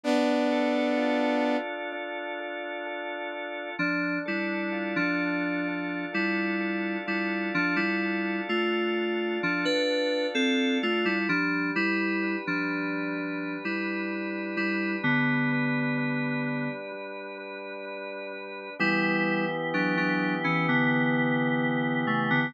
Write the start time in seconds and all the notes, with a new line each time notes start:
0.04 B3 D4
0.52 A4
0.97 F4
1.44 A4
1.92 D4
2.40 A4
2.86 A4
3.32 F4
3.79 F3 D4
4.26 G3 E4 A4
4.72 F4
4.96 F3 D4
5.22 A4
5.68 D4
6.13 G3 E4 A4
6.60 A4
7.06 G3 E4 F4
7.54 F3 D4
7.76 G3 E4
8.02 A4
8.49 A3 F4
8.93 A4
9.40 F3 D4
9.65 D4 B4
9.87 A4
10.35 C4 A4
10.83 A3 F4
11.05 G3 E4
11.29 F3 G3 D4
11.75 G3 E4 B4
12.23 D4
12.47 F3 D4
12.71 B4
13.18 G3
13.64 G3 E4 B4
14.10 B4
14.57 G3 D4 E4
15.03 D3 G3 B3
15.52 B4
15.98 D4
16.45 B4
16.92 G3
17.38 B4
17.85 B4
18.33 D4
18.79 E3 G3 B3 E4 G4
19.74 F#3 D4
19.97 F#3 D4
20.44 E3 C#4
20.69 D3 B3
22.07 C#3 A3
22.30 D3 B3